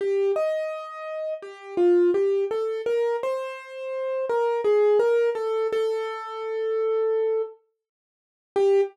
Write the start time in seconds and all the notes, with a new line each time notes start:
0.01 G4
0.36 D#5
1.42 G4
1.77 F4
2.14 G4
2.51 A4
2.86 A#4
3.23 C5
4.29 A#4
4.64 G#4
4.99 A#4
5.35 A4
5.72 A4
8.56 G4